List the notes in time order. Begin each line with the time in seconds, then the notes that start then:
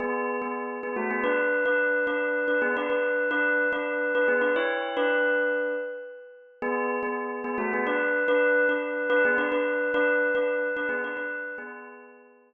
0.00 B3 G#4
0.42 B3 G#4
0.83 B3 G#4
0.96 A3 F#4
1.11 B3 G#4
1.24 D4 B4
1.66 D4 B4
2.07 D4 B4
2.48 D4 B4
2.62 B3 G#4
2.77 D4 B4
2.90 D4 B4
3.31 D4 B4
3.72 D4 B4
4.15 D4 B4
4.28 B3 G#4
4.41 D4 B4
4.56 E4 C#5
4.97 D4 B4
6.62 B3 G#4
7.03 B3 G#4
7.44 B3 G#4
7.58 A3 F#4
7.73 B3 G#4
7.87 D4 B4
8.28 D4 B4
8.69 D4 B4
9.10 D4 B4
9.25 B3 G#4
9.38 D4 B4
9.52 D4 B4
9.94 D4 B4
10.35 D4 B4
10.76 D4 B4
10.89 B3 G#4
11.04 D4 B4
11.17 D4 B4
11.58 B3 G#4